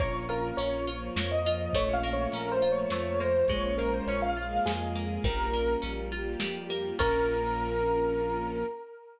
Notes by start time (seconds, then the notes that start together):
0.00 A#1 A#3 C#4 F4 C#5, kick, closed hi-hat
0.29 F4 A#4
0.57 A#1 C#4 C#5, closed hi-hat
0.87 F3 A#3 F4
1.16 F2 A#3 C#5, snare
1.32 D#5
1.46 F4
1.73 A#1 A3 A#3 C#4 F4 C#5, kick, closed hi-hat
1.93 F5
2.04 A#3
2.13 C#5
2.32 A#1 C#4 A#4, closed hi-hat
2.52 C5
2.62 F3 A3 A#3 F4
2.72 C#5
2.90 F2 A3 C#5, snare
3.20 A#3 C5
3.48 A#1 G#3 A#3 C#4 F4 C#5, kick, closed hi-hat
3.78 A#3 A#4
3.94 C5
4.07 A#1 C#4 C#5, closed hi-hat
4.22 F5
4.37 G#3 A#3 F4 G#4
4.66 F2 G#3 G#4, snare
4.95 A#3
5.24 A#1 G3 A#3 C#4 F4 A#4, kick, closed hi-hat
5.53 A#3
5.82 A#1 C#4, closed hi-hat
6.11 G3 A#3 F4 G4
6.40 F2 G3, snare
6.70 A#3
6.98 A#1 A#3 C#4 F4 A#4, kick, crash